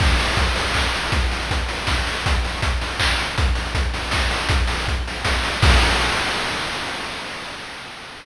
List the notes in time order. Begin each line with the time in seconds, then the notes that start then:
0.00 kick, crash
0.19 open hi-hat
0.36 kick, closed hi-hat
0.56 open hi-hat
0.74 kick, clap
0.94 open hi-hat
1.12 kick, closed hi-hat
1.31 open hi-hat
1.51 kick, closed hi-hat
1.69 open hi-hat
1.87 kick, snare
2.07 open hi-hat
2.26 kick, closed hi-hat
2.44 open hi-hat
2.62 kick, closed hi-hat
2.81 open hi-hat
3.00 kick, clap
3.19 open hi-hat
3.38 kick, closed hi-hat
3.55 open hi-hat
3.75 kick, closed hi-hat
3.94 open hi-hat
4.11 kick, snare
4.31 open hi-hat
4.49 kick, closed hi-hat
4.67 open hi-hat
4.88 kick, closed hi-hat
5.07 open hi-hat
5.25 kick, snare
5.44 open hi-hat
5.62 kick, crash